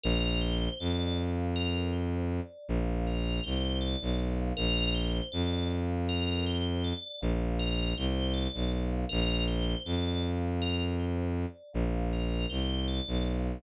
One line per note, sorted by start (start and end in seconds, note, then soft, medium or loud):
0.04 0.69 A#1 loud
0.04 0.38 A#4 loud
0.41 0.75 C5 medium
0.80 2.40 F2 medium
0.80 1.14 D5 medium
1.18 1.52 F5 medium
1.56 1.90 A#4 medium
1.93 2.27 C5 medium
2.31 2.65 D5 medium
2.69 3.40 A#1 medium
2.69 3.04 F5 medium
3.07 3.41 A#4 medium
3.44 3.96 C2 medium
3.44 3.78 C5 medium
3.81 4.15 D5 medium
4.02 4.53 B1 medium
4.19 4.53 F5 medium
4.57 5.21 A#1 medium
4.57 4.91 A#4 loud
4.95 5.29 C5 medium
5.32 6.93 F2 medium
5.32 5.66 D5 medium
5.71 6.05 F5 medium
6.09 6.43 A#4 medium
6.46 6.80 C5 medium
6.84 7.18 D5 medium
7.21 7.94 A#1 medium
7.21 7.55 F5 medium
7.59 7.93 A#4 medium
7.97 8.48 C2 medium
7.97 8.32 C5 medium
8.34 8.68 D5 medium
8.54 9.05 B1 medium
8.72 9.06 F5 medium
9.09 9.75 A#1 loud
9.09 9.43 A#4 loud
9.48 9.82 C5 medium
9.85 11.46 F2 medium
9.85 10.20 D5 medium
10.23 10.57 F5 medium
10.62 10.96 A#4 medium
11.00 11.33 C5 medium
11.38 11.72 D5 medium
11.73 12.46 A#1 medium
11.73 12.07 F5 medium
12.13 12.47 A#4 medium
12.50 13.01 C2 medium
12.50 12.84 C5 medium
12.88 13.22 D5 medium
13.08 13.58 B1 medium
13.25 13.59 F5 medium